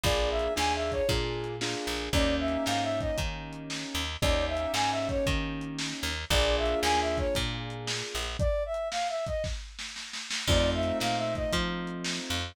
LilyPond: <<
  \new Staff \with { instrumentName = "Brass Section" } { \time 4/4 \key bes \major \tempo 4 = 115 d''8 e''8 \tuplet 3/2 { aes''8 e''8 des''8 } r2 | d''8 e''8 \tuplet 3/2 { f''8 fes''8 ees''8 } r2 | d''8 e''8 \tuplet 3/2 { aes''8 e''8 des''8 } r2 | d''8 e''8 \tuplet 3/2 { aes''8 e''8 cis''8 } r2 |
d''8 e''8 \tuplet 3/2 { f''8 fes''8 ees''8 } r2 | d''8 e''8 \tuplet 3/2 { f''8 fes''8 ees''8 } r2 | }
  \new Staff \with { instrumentName = "Acoustic Grand Piano" } { \time 4/4 \key bes \major <bes d' f' aes'>4 <bes d' f' aes'>4 <bes d' f' aes'>4 <bes d' f' aes'>4 | <bes des' ees' g'>1 | <bes des' ees' g'>1 | <bes d' f' aes'>1 |
r1 | <a c' ees' f'>1 | }
  \new Staff \with { instrumentName = "Electric Bass (finger)" } { \clef bass \time 4/4 \key bes \major bes,,4 ees,4 bes,4. bes,,8 | ees,4 aes,4 ees4. ees,8 | ees,4 aes,4 ees4. ees,8 | bes,,4 ees,4 bes,4. bes,,8 |
r1 | f,4 bes,4 f4. f,8 | }
  \new DrumStaff \with { instrumentName = "Drums" } \drummode { \time 4/4 \tuplet 3/2 { <hh bd>8 r8 hh8 sn8 r8 <hh bd>8 <hh bd>8 r8 hh8 sn8 r8 hh8 } | \tuplet 3/2 { <hh bd>8 r8 hh8 sn8 r8 <hh bd>8 <hh bd>8 r8 hh8 sn8 r8 hh8 } | \tuplet 3/2 { <hh bd>8 r8 hh8 sn8 r8 <hh bd>8 <hh bd>8 r8 hh8 sn8 r8 hh8 } | \tuplet 3/2 { <hh bd>8 r8 hh8 sn8 r8 <hh bd>8 <hh bd>8 r8 hh8 sn8 r8 hh8 } |
\tuplet 3/2 { <hh bd>8 r8 hh8 sn8 r8 <hh bd>8 <bd sn>8 r8 sn8 sn8 sn8 sn8 } | \tuplet 3/2 { <cymc bd>8 r8 hh8 sn8 r8 <hh bd>8 <hh bd>8 r8 hh8 sn8 r8 hh8 } | }
>>